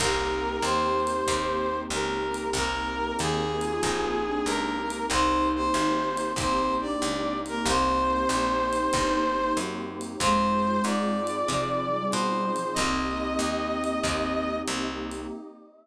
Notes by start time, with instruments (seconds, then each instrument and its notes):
0.00 electric bass (finger) C2, acoustic guitar (steel) A#3 C4 D#4 G4, pad 2 (warm) A#3 C4 D#4 G4, flute G4, brass section A#4, kick, crash, ride
0.62 electric bass (finger) D#2, flute G4, brass section C5, hi-hat pedal, ride
1.07 ride
1.27 electric bass (finger) D#2, acoustic guitar (steel) A#3 C4 D#4 G4, kick, ride
1.90 electric bass (finger) C#2, flute G4, brass section A#4, hi-hat pedal, ride
2.34 ride
2.53 electric bass (finger) C2, pad 2 (warm) A#3 C4 D#4 G4, acoustic guitar (steel) A#3 C4 D#4 G4, brass section A#4, kick, ride
3.19 electric bass (finger) D#2, brass section G#4, hi-hat pedal, ride
3.61 flute F4, ride
3.83 electric bass (finger) A#1, acoustic guitar (steel) A#3 C4 D#4 G4, kick, ride
4.26 flute D4
4.46 electric bass (finger) C#2, brass section A#4, hi-hat pedal, ride
4.90 ride
5.10 electric bass (finger) C2, acoustic guitar (steel) A#3 C4 D#4 G4, pad 2 (warm) A#3 C4 D#4 G4, flute D#4, brass section C5, kick, ride
5.55 brass section C5
5.74 electric bass (finger) G#1, hi-hat pedal, ride
6.17 ride
6.36 electric bass (finger) A#1, acoustic guitar (steel) A#3 C4 D#4 G4, flute C4, brass section C5, kick, ride
6.81 flute D4, brass section D5
7.02 electric bass (finger) C#2, hi-hat pedal, ride
7.45 flute A#3, brass section A#4, ride
7.66 electric bass (finger) C2, pad 2 (warm) A#3 C4 D#4 G4, acoustic guitar (steel) A#3 C4 D#4 G4, flute C4, brass section C5, kick, ride
8.29 electric bass (finger) A#1, hi-hat pedal, ride
8.73 flute D#4, ride
8.93 electric bass (finger) G1, acoustic guitar (steel) A#3 C4 D#4 G4, kick, ride
9.57 electric bass (finger) F#2, hi-hat pedal, ride
10.01 ride
10.20 electric bass (finger) F2, flute G#3, pad 2 (warm) C4 D#4 F4 G#4, acoustic guitar (steel) C4 D#4 F4 G#4, brass section C5, kick, ride
10.84 electric bass (finger) G#2, brass section D5, hi-hat pedal, ride
11.27 ride
11.48 electric bass (finger) C3, flute F3, acoustic guitar (steel) C4 D#4 F4 G#4, kick, ride
11.92 flute G3
12.11 electric bass (finger) B2, brass section C5, hi-hat pedal, ride
12.56 flute F3, ride
12.74 acoustic guitar (steel) A#3 C4 D#4 G4, pad 2 (warm) A#3 C4 D#4 G4, flute C4, brass section D#5, kick, ride
12.78 electric bass (finger) C2
13.39 electric bass (finger) D#2, hi-hat pedal, ride
13.84 ride
14.03 electric bass (finger) D#2, acoustic guitar (steel) A#3 C4 D#4 G4, kick, ride
14.68 electric bass (finger) C2, hi-hat pedal, ride
15.11 ride